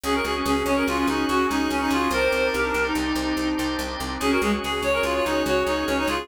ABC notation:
X:1
M:5/4
L:1/16
Q:1/4=144
K:Dblyd
V:1 name="Clarinet"
A B A z A2 d B F F E2 _G2 E2 D E F2 | B8 z12 | A B A z A2 d B F F E2 _G2 E2 D E F2 |]
V:2 name="Clarinet"
D z2 D D D D2 D8 D4 | c4 G =D2 E9 z4 | D _G A, z A2 d2 d4 d4 d d A2 |]
V:3 name="Drawbar Organ"
[_GAd] [GAd]6 [GAd] [GAd] [GAd] [GAd]4 [GAd]3 [GAd]3 | [Gc=de] [Gcde]6 [Gcde] [Gcde] [Gcde] [Gcde]4 [Gcde]3 [Gcde]3 | [_GAd] [GAd]6 [GAd] [GAd] [GAd] [GAd]4 [GAd]3 [GAd]3 |]
V:4 name="Electric Bass (finger)" clef=bass
D,,2 D,,2 D,,2 D,,2 D,,2 D,,2 D,,2 D,,2 D,,2 D,,2 | C,,2 C,,2 C,,2 C,,2 C,,2 C,,2 C,,2 C,,2 C,,2 C,,2 | D,,2 D,,2 D,,2 D,,2 D,,2 D,,2 D,,2 D,,2 D,,2 D,,2 |]
V:5 name="Drawbar Organ"
[D_GA]20 | [C=DEG]20 | [D_GA]20 |]